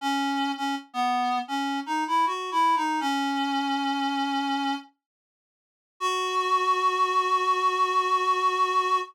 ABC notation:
X:1
M:4/4
L:1/16
Q:1/4=80
K:F#dor
V:1 name="Clarinet"
C3 C z B,3 C2 D E (3F2 E2 D2 | C10 z6 | F16 |]